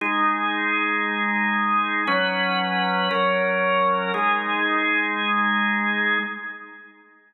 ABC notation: X:1
M:12/8
L:1/8
Q:3/8=116
K:Ab
V:1 name="Drawbar Organ"
[A,EA]12 | [_G,D_c]6 [G,DB]6 | [A,EA]12 |]